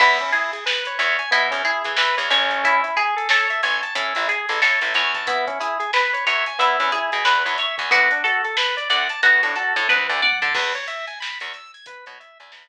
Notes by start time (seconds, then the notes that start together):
0.00 E2 B3 E4, kick, crash
0.19 C#4, closed hi-hat
0.32 E4 G#4, closed hi-hat
0.53 G#4, closed hi-hat
0.66 B4, snare
0.85 C#5, closed hi-hat
0.98 E2 C#5 E5, snare, closed hi-hat
1.19 G#5, closed hi-hat
1.31 B2 B3 E4, kick, closed hi-hat
1.51 E2 C#4, closed hi-hat
1.65 E4 G#4, closed hi-hat
1.84 E3 G#4, kick, closed hi-hat
1.97 E3 B4, snare
2.17 E2 C#5, closed hi-hat
2.30 A1 C#4 C#5, closed hi-hat
2.50 kick, closed hi-hat
2.64 E4, kick, closed hi-hat
2.84 E4, closed hi-hat
2.96 G#4, kick, closed hi-hat
3.16 A4, closed hi-hat
3.29 A4 C#5, snare
3.50 E5, closed hi-hat
3.63 A1 C#5 G#5, closed hi-hat
3.82 A5, closed hi-hat
3.95 A2 C#4 E4, kick, closed hi-hat
4.15 A1 E4, closed hi-hat
4.28 G#4, closed hi-hat
4.49 A1 A4, closed hi-hat
4.62 A2 A4 C#5, snare
4.81 A1 E5, closed hi-hat
4.94 E2 C#5 G#5, closed hi-hat
5.14 A5, kick, snare, closed hi-hat
5.27 B3 E4, kick, closed hi-hat
5.47 C#4, kick, closed hi-hat
5.60 E4 G#4, snare, closed hi-hat
5.80 G#4, closed hi-hat
5.93 B4, snare
6.13 C#5, closed hi-hat
6.27 E2 C#5 E5, closed hi-hat
6.46 G#5, snare, closed hi-hat
6.59 E2 B3 E4, kick, closed hi-hat
6.80 E2 C#4, closed hi-hat
6.92 E4 G#4, closed hi-hat
7.12 B2 G#4, closed hi-hat
7.25 E2 B4, snare
7.45 E2 C#5, closed hi-hat
7.58 C#5 E5, snare, closed hi-hat
7.78 E2 G#5, kick, closed hi-hat
7.91 D2 B3 F#4, kick, closed hi-hat
8.11 D4, closed hi-hat
8.24 F#4 A4, closed hi-hat
8.45 A4, closed hi-hat
8.57 B4, snare
8.77 D5, closed hi-hat
8.89 D2 D5 F#5, closed hi-hat
9.09 A5, closed hi-hat
9.23 D2 B3 F#4, kick, closed hi-hat
9.43 A2 D4, closed hi-hat
9.55 F#4 A4, closed hi-hat
9.76 A2 A4, kick, closed hi-hat
9.89 D2 B4, kick, high tom
10.09 D2 D5, floor tom
10.22 D5 F#5, high tom
10.42 D3 A5, floor tom
10.55 E2 B4, kick, crash
10.75 C#5, closed hi-hat
10.88 E5, closed hi-hat
11.07 G#5, closed hi-hat
11.20 B5, snare
11.40 E2 C#6, closed hi-hat
11.54 E6, snare, closed hi-hat
11.74 G#6, closed hi-hat
11.86 B4, kick, closed hi-hat
12.06 B2 C#5, closed hi-hat
12.20 E5, closed hi-hat
12.40 E2 G#5, closed hi-hat
12.52 E2 B5, snare